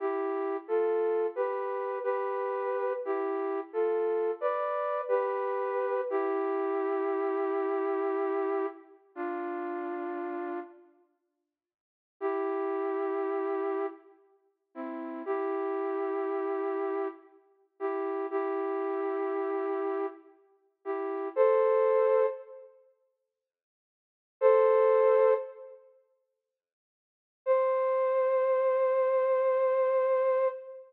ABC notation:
X:1
M:3/4
L:1/8
Q:1/4=59
K:Gmix
V:1 name="Flute"
(3[EG]2 [FA]2 [GB]2 [GB]2 | (3[EG]2 [FA]2 [Bd]2 [GB]2 | [EG]6 | [DF]3 z3 |
[K:Cmix] [EG]4 z [CE] | [EG]4 z [EG] | [EG]4 z [EG] | [Ac]2 z4 |
[Ac]2 z4 | c6 |]